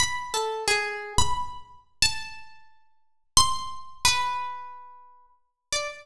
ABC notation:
X:1
M:3/4
L:1/16
Q:1/4=89
K:none
V:1 name="Orchestral Harp"
b2 A2 _A3 b z4 | a8 c'4 | B8 z2 d z |]